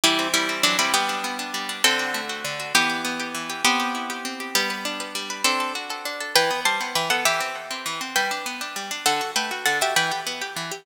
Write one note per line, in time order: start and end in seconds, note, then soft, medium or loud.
0.03 0.63 E3 loud
0.03 0.28 G3 medium
0.03 0.28 E4 medium
0.19 0.48 C4 medium
0.33 0.62 G3 medium
0.33 0.62 E4 medium
0.49 0.78 C4 medium
0.63 0.92 E3 loud
0.63 0.77 F#3 medium
0.63 0.77 D4 medium
0.78 0.92 G3 medium
0.78 0.93 C4 medium
0.78 0.92 E4 medium
0.93 1.53 G3 loud
0.93 1.76 B3 medium
0.93 1.76 G4 medium
1.09 1.38 D4 medium
1.24 1.81 B3 medium
1.39 1.68 D4 medium
1.54 1.82 G3 medium
1.69 1.83 D4 medium
1.84 2.44 D3 loud
1.84 2.20 C4 medium
1.84 2.20 A4 medium
1.99 2.29 F#4 medium
2.14 2.71 A3 medium
2.29 2.59 F#4 medium
2.44 2.73 D3 medium
2.59 2.73 F#4 medium
2.74 3.34 E3 loud
2.74 3.53 B3 medium
2.74 3.53 G4 medium
2.89 3.19 G4 medium
3.04 3.61 B3 medium
3.19 3.49 G4 medium
3.34 3.63 E3 medium
3.49 3.64 G4 medium
3.64 4.50 B3 medium
3.64 4.24 C4 loud
3.64 4.50 G4 medium
3.79 4.09 G4 medium
3.94 4.52 E4 medium
4.10 4.39 G4 medium
4.25 4.53 C4 medium
4.40 4.54 G4 medium
4.55 5.14 G3 loud
4.55 5.40 B3 medium
4.55 5.40 G4 medium
4.70 4.99 B4 medium
4.85 5.42 D4 medium
5.00 5.29 B4 medium
5.15 5.43 G3 medium
5.30 5.44 B4 medium
5.44 5.73 C4 medium
5.44 6.05 D4 loud
5.44 5.73 A4 medium
5.60 5.89 A4 medium
5.75 6.32 F#4 medium
5.90 6.20 A4 medium
6.05 6.34 D4 medium
6.20 6.34 A4 medium
6.35 6.50 E3 loud
6.35 6.60 B4 medium
6.35 6.60 G5 medium
6.50 6.65 B3 medium
6.65 6.80 G3 medium
6.65 6.94 C5 medium
6.65 6.94 A5 medium
6.80 6.95 B3 medium
6.95 7.10 E3 loud
6.95 7.09 B4 medium
6.95 7.09 G5 medium
7.10 7.25 B3 medium
7.10 7.24 A4 medium
7.10 7.24 F#5 medium
7.25 7.40 E3 loud
7.25 8.05 G4 medium
7.25 8.05 E5 medium
7.40 7.55 C4 medium
7.70 7.85 C4 medium
7.85 8.00 E3 loud
8.01 8.15 C4 medium
8.15 8.31 G3 loud
8.15 8.58 B4 medium
8.15 8.58 G5 medium
8.31 8.46 D4 medium
8.46 8.61 B3 medium
8.61 8.76 D4 medium
8.76 8.91 G3 medium
8.91 9.05 D4 medium
9.06 9.21 D3 loud
9.06 9.31 A4 medium
9.06 9.31 F#5 medium
9.21 9.36 F#4 medium
9.36 9.51 A3 medium
9.36 9.65 B4 medium
9.36 9.65 G5 medium
9.51 9.66 F#4 medium
9.65 9.81 D3 medium
9.65 9.78 A4 medium
9.65 9.78 F#5 medium
9.81 9.95 F#4 medium
9.81 9.94 G4 medium
9.81 9.94 E5 medium
9.96 10.11 E3 loud
9.96 10.20 B4 medium
9.96 10.20 G5 medium
10.11 10.26 G4 medium
10.26 10.41 B3 medium
10.41 10.56 G4 medium
10.56 10.71 E3 medium
10.71 10.86 G4 medium